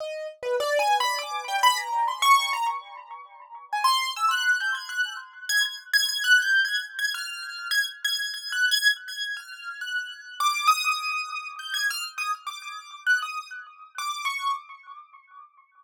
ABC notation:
X:1
M:7/8
L:1/16
Q:1/4=101
K:none
V:1 name="Acoustic Grand Piano"
_e2 z B (3d2 _a2 b2 d'2 g b _b2 | c' _d'2 _b z7 _a c'2 | e' _g'2 =g' _a' _g'2 z2 a' a' z a' a' | (3_g'2 =g'2 _a'2 z a' f'4 a' z a'2 |
(3_a'2 _g'2 a'2 z a'2 f'3 g'4 | d'2 _e'6 g' _a' f' z e' z | d'4 _g' _e'2 z3 d'2 _d'2 |]